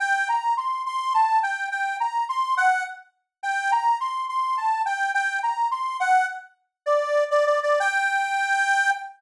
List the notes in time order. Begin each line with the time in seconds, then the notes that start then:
0.00 G5
0.29 A#5
0.57 C6
0.86 C6
1.14 A5
1.43 G5
1.72 G5
2.00 A#5
2.29 C6
2.57 F#5
3.43 G5
3.72 A#5
4.00 C6
4.29 C6
4.57 A5
4.86 G5
5.14 G5
5.43 A#5
5.71 C6
6.00 F#5
6.86 D5
7.31 D5
7.46 D5
7.63 D5
7.80 G5